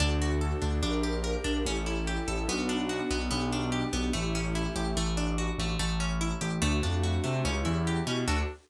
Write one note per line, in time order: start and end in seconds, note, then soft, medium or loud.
0.00 0.53 D2 loud
0.00 0.61 D4 loud
0.00 0.81 D4 medium
0.00 0.82 F#4 medium
0.00 0.82 A4 medium
0.22 0.81 F#4 medium
0.41 0.81 A4 medium
0.62 0.80 D2 loud
0.62 0.81 D4 medium
0.82 1.36 A#1 loud
0.82 1.64 D4 medium
0.82 1.44 D4 loud
0.82 1.64 G4 medium
0.82 1.64 A#4 medium
1.03 1.62 G4 medium
1.24 1.63 A#4 medium
1.44 1.62 A#1 loud
1.44 1.64 D4 loud
1.66 2.18 A1 loud
1.66 2.48 C#4 medium
1.66 2.45 C#4 loud
1.66 2.48 E4 medium
1.66 2.48 G4 medium
1.66 2.48 A4 medium
1.86 2.45 E4 medium
2.07 2.47 G4 medium
2.28 2.45 A1 loud
2.28 2.47 A4 medium
2.48 3.01 B1 loud
2.48 3.29 B3 medium
2.48 3.10 B3 loud
2.48 3.29 D4 medium
2.48 3.29 F#4 medium
2.69 3.28 D4 medium
2.89 3.29 F#4 medium
3.11 3.28 B1 loud
3.11 3.30 B3 medium
3.29 3.84 B1 loud
3.29 4.11 B3 medium
3.29 3.92 B3 loud
3.29 4.11 D4 medium
3.29 4.11 G4 medium
3.52 4.11 D4 medium
3.72 4.11 G4 medium
3.93 4.11 B1 loud
3.93 4.12 B3 medium
4.13 4.67 A1 loud
4.13 4.92 A3 loud
4.13 4.96 A3 medium
4.13 4.96 C#4 medium
4.13 4.96 E4 medium
4.13 4.96 G4 medium
4.35 4.94 C#4 medium
4.55 4.94 E4 medium
4.76 4.93 A1 loud
4.76 4.95 G4 medium
4.96 5.49 A1 loud
4.96 5.59 A3 loud
5.17 5.76 D4 medium
5.38 5.77 F#4 medium
5.58 5.76 A1 loud
5.58 5.79 A3 medium
5.79 6.32 A1 loud
5.79 6.58 A3 loud
6.00 6.59 C#4 medium
6.21 6.60 E4 loud
6.41 6.59 A1 loud
6.41 6.61 G4 medium
6.62 6.80 D2 loud
6.62 7.23 A3 loud
6.62 7.44 A3 loud
6.62 7.44 D4 medium
6.62 7.44 F#4 medium
6.83 7.18 F2 medium
6.83 7.42 D4 medium
7.03 7.43 F#4 medium
7.24 7.42 C3 medium
7.24 7.43 A3 medium
7.44 7.62 C#2 loud
7.44 8.26 C#4 medium
7.44 8.06 C#4 loud
7.44 8.26 E4 medium
7.44 8.26 G4 medium
7.65 8.01 E2 loud
7.65 8.24 E4 medium
7.87 8.26 G4 medium
8.07 8.24 B2 medium
8.07 8.27 C#4 medium
8.28 8.42 D2 loud
8.28 8.42 D4 loud
8.28 8.42 F#4 medium
8.28 8.42 F#4 loud
8.28 8.42 A4 loud
8.28 8.42 A4 medium